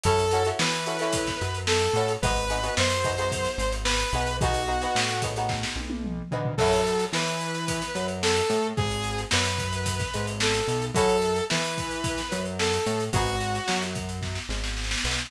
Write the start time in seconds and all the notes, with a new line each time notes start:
0.03 F#2 C#4 E4 F#4 A4, kick, closed hi-hat
0.19 closed hi-hat
0.31 C#4 E4 F#4 A4, closed hi-hat
0.45 C#4 E4 F#4 A4, closed hi-hat
0.59 E3 B4, snare
0.72 closed hi-hat
0.86 C#4 E4 F#4 A4, closed hi-hat
0.99 C#4 E4 F#4 A4, snare, closed hi-hat
1.13 kick, closed hi-hat
1.26 kick, snare, closed hi-hat
1.41 F#2, closed hi-hat
1.54 closed hi-hat
1.67 A4, snare
1.81 snare, closed hi-hat
1.93 A2 C#4 E4 F#4 A4, closed hi-hat
2.08 closed hi-hat
2.22 G#1 B3 D#4 F#4 G#4 B4, kick, closed hi-hat
2.36 closed hi-hat
2.50 B3 D#4 F#4 G#4, closed hi-hat
2.63 B3 D#4 F#4 G#4, closed hi-hat
2.77 F#2 C5, snare
2.90 closed hi-hat
3.04 B3 D#4 F#4 G#4, kick, closed hi-hat
3.18 B3 D#4 F#4 G#4, closed hi-hat
3.32 kick, closed hi-hat
3.45 snare, closed hi-hat
3.58 G#1, snare, closed hi-hat
3.72 snare, closed hi-hat
3.85 B4, snare
3.99 snare, closed hi-hat
4.13 B1 B3 D#4 F#4 G#4, closed hi-hat
4.27 closed hi-hat
4.41 B3 D#4 F#4 G#4, kick, closed hi-hat
4.54 closed hi-hat
4.67 B3 D#4 F#4 G#4
4.81 B3 D#4 F#4 G#4, closed hi-hat
4.95 A2, snare
5.09 closed hi-hat
5.22 B3 D#4 F#4 G#4, kick, snare, closed hi-hat
5.36 B3 D#4 F#4 G#4, snare, closed hi-hat
5.49 kick, snare
5.63 snare
5.76 B1, high tom
5.90 high tom
6.04 mid tom
6.31 D2 B3 D#4 F#4 G#4, floor tom
6.45 floor tom
6.57 F#2 C#4 E4 F#4 A4, kick, crash
6.73 closed hi-hat
6.86 closed hi-hat
6.99 closed hi-hat
7.13 E3 E4 B4, snare
7.27 closed hi-hat
7.40 closed hi-hat
7.54 closed hi-hat
7.68 kick, closed hi-hat
7.82 snare, closed hi-hat
7.95 F#2 F#3, closed hi-hat
8.08 closed hi-hat
8.22 A4, snare
8.36 closed hi-hat
8.50 A2 A3, closed hi-hat
8.77 G#1 G#4, kick, closed hi-hat
8.91 closed hi-hat
9.04 closed hi-hat
9.18 snare, closed hi-hat
9.31 F#2 F#3 B4, snare
9.45 closed hi-hat
9.58 kick, closed hi-hat
9.73 closed hi-hat
9.86 kick, closed hi-hat
9.99 kick, snare, closed hi-hat
10.14 G#1 G#3, snare, closed hi-hat
10.27 closed hi-hat
10.40 A4, snare
10.54 snare, closed hi-hat
10.68 B1 B3, closed hi-hat
10.82 closed hi-hat
10.94 F#2 C#4 E4 F#4 A4, kick, closed hi-hat
11.09 closed hi-hat
11.22 closed hi-hat
11.36 closed hi-hat
11.50 E3 E4 B4, snare
11.64 closed hi-hat
11.78 kick, closed hi-hat
11.91 closed hi-hat
12.04 kick, closed hi-hat
12.18 snare, closed hi-hat
12.31 F#2 F#3, closed hi-hat
12.45 closed hi-hat
12.59 A4, snare
12.73 closed hi-hat
12.86 A2 A3, closed hi-hat
13.00 closed hi-hat
13.13 G#1 B3 D#4 F#4 G#4, kick, closed hi-hat
13.26 closed hi-hat
13.40 closed hi-hat
13.55 closed hi-hat
13.68 F#2 F#3, snare
13.82 snare, closed hi-hat
13.95 kick, closed hi-hat
14.09 closed hi-hat
14.22 kick, snare
14.35 snare
14.49 G#1 G#3, snare
14.64 snare
14.77 snare
14.84 snare
14.91 snare
14.98 snare
15.04 B1 B3, snare
15.11 snare
15.19 snare
15.25 snare